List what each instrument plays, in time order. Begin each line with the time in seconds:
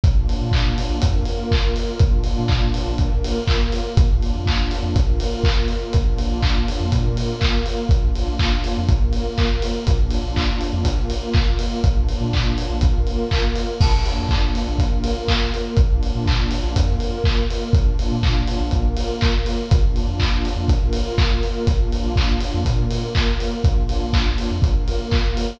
0.04 synth bass 2 A#1, pad 2 (warm) A#3 D4 F4, kick, closed hi-hat
0.29 open hi-hat
0.41 synth bass 2 A#2
0.51 kick, clap
0.78 open hi-hat
0.89 synth bass 2 A#1
1.02 synth bass 2 F2, pad 2 (warm) A#3 F4 A#4, kick, closed hi-hat
1.25 open hi-hat
1.51 kick, clap
1.76 open hi-hat
1.99 synth bass 2 A#1, pad 2 (warm) A#3 D4 F4, kick, closed hi-hat
2.24 open hi-hat
2.38 synth bass 2 A#2
2.48 kick, clap
2.74 open hi-hat
2.86 synth bass 2 A#1
2.98 synth bass 2 A#1, pad 2 (warm) A#3 F4 A#4, kick, closed hi-hat
3.24 open hi-hat
3.47 kick, clap
3.72 open hi-hat
3.97 synth bass 2 A#1, pad 2 (warm) A#3 D4 F4, kick, closed hi-hat
4.22 open hi-hat
4.35 synth bass 2 F2
4.46 kick, clap
4.71 open hi-hat
4.83 synth bass 2 F2
4.94 synth bass 2 A#1, pad 2 (warm) A#3 F4 A#4, kick, closed hi-hat
5.20 open hi-hat
5.44 kick, clap
5.68 open hi-hat
5.93 synth bass 2 A#1, pad 2 (warm) A#3 D4 F4, kick, closed hi-hat
6.18 open hi-hat
6.30 synth bass 2 A#1
6.43 kick, clap
6.68 open hi-hat
6.80 synth bass 2 F2
6.91 synth bass 2 A#2, pad 2 (warm) A#3 F4 A#4, kick, closed hi-hat
7.17 open hi-hat
7.41 kick, clap
7.66 open hi-hat
7.89 synth bass 2 A#1, pad 2 (warm) A#3 D4 F4, kick, closed hi-hat
8.15 open hi-hat
8.28 synth bass 2 A#1
8.39 kick, clap
8.64 open hi-hat
8.77 synth bass 2 F2
8.88 synth bass 2 A#1, pad 2 (warm) A#3 F4 A#4, kick, closed hi-hat
9.13 open hi-hat
9.38 kick, clap
9.62 open hi-hat
9.87 synth bass 2 A#1, pad 2 (warm) A#3 D4 F4, kick, closed hi-hat
10.10 open hi-hat
10.24 synth bass 2 A#1
10.36 kick, clap
10.61 open hi-hat
10.73 synth bass 2 F2
10.85 synth bass 2 A#1, pad 2 (warm) A#3 F4 A#4, kick, closed hi-hat
11.10 open hi-hat
11.34 kick, clap
11.59 open hi-hat
11.83 synth bass 2 A#1, pad 2 (warm) A#3 D4 F4, kick, closed hi-hat
12.09 open hi-hat
12.21 synth bass 2 A#2
12.33 kick, clap
12.58 open hi-hat
12.70 synth bass 2 A#1
12.81 synth bass 2 A#1, pad 2 (warm) A#3 F4 A#4, kick, closed hi-hat
13.07 open hi-hat
13.31 kick, clap
13.55 open hi-hat
13.81 synth bass 2 A#1, pad 2 (warm) A#3 D4 F4, kick, crash
14.06 open hi-hat
14.18 synth bass 2 F2
14.29 kick, clap
14.55 open hi-hat
14.67 synth bass 2 A#1
14.79 synth bass 2 A#1, pad 2 (warm) A#3 F4 A#4, kick, closed hi-hat
15.04 open hi-hat
15.28 kick, clap
15.54 open hi-hat
15.77 synth bass 2 A#1, pad 2 (warm) A#3 D4 F4, kick, closed hi-hat
16.03 open hi-hat
16.15 synth bass 2 A#2
16.26 kick, clap
16.51 open hi-hat
16.64 synth bass 2 A#1
16.75 synth bass 2 F2, pad 2 (warm) A#3 F4 A#4, kick, closed hi-hat
17.00 open hi-hat
17.24 kick, clap
17.50 open hi-hat
17.73 synth bass 2 A#1, pad 2 (warm) A#3 D4 F4, kick, closed hi-hat
17.99 open hi-hat
18.11 synth bass 2 A#2
18.23 kick, clap
18.47 open hi-hat
18.60 synth bass 2 A#1
18.71 synth bass 2 A#1, pad 2 (warm) A#3 F4 A#4, kick, closed hi-hat
18.97 open hi-hat
19.21 kick, clap
19.46 open hi-hat
19.70 synth bass 2 A#1, pad 2 (warm) A#3 D4 F4, kick, closed hi-hat
19.96 open hi-hat
20.07 synth bass 2 F2
20.20 kick, clap
20.45 open hi-hat
20.56 synth bass 2 F2
20.68 synth bass 2 A#1, pad 2 (warm) A#3 F4 A#4, kick, closed hi-hat
20.93 open hi-hat
21.18 kick, clap
21.43 open hi-hat
21.67 synth bass 2 A#1, pad 2 (warm) A#3 D4 F4, kick, closed hi-hat
21.92 open hi-hat
22.03 synth bass 2 A#1
22.16 kick, clap
22.40 open hi-hat
22.54 synth bass 2 F2
22.65 synth bass 2 A#2, pad 2 (warm) A#3 F4 A#4, kick, closed hi-hat
22.90 open hi-hat
23.15 kick, clap
23.40 open hi-hat
23.64 synth bass 2 A#1, pad 2 (warm) A#3 D4 F4, kick, closed hi-hat
23.89 open hi-hat
24.01 synth bass 2 A#1
24.13 kick, clap
24.38 open hi-hat
24.51 synth bass 2 F2
24.62 synth bass 2 A#1, pad 2 (warm) A#3 F4 A#4, kick, closed hi-hat
24.88 open hi-hat
25.11 kick, clap
25.37 open hi-hat